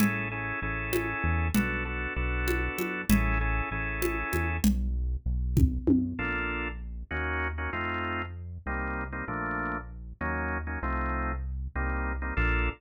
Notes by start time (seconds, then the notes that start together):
0.00 A1 C#4 E4 G#4 A4, low conga
0.31 C#4 E4 G#4 A4
0.62 A1 C#4 E4 G#4 A4
0.93 high conga
1.24 E2
1.55 B1 B3 D4 F#4 A4, low conga
1.85 B3 D4 F#4 A4
2.16 B1 B3 D4 F#4 A4
2.48 high conga
2.78 F#2, high conga
3.09 A1 C#4 E4 G#4 A4, low conga
3.41 C#4 E4 G#4 A4
3.71 A1 C#4 E4 G#4 A4
4.02 high conga
4.33 E2, high conga
4.64 B1, low conga
5.26 B1
5.57 kick, high tom
5.87 F#2, high tom
6.19 A#1 A#3 D4 F4 A4
7.11 D#2 A#3 C#4 D#4 F#4
7.58 A#3 C#4 D#4 F#4
7.73 F2 A3 C4 D#4 F4
8.66 C2 G3 A#3 C4 D#4
9.13 G3 A#3 C4 D#4
9.28 A#1 F3 A3 A#3 D4
10.21 D#2 F#3 A#3 C#4 D#4
10.67 F#3 A#3 C#4 D#4
10.82 C2 F3 A3 C4 D#4
11.75 C2 G3 A#3 C4 D#4
12.22 G3 A#3 C4 D#4
12.37 A#1 A#3 D4 F4 A4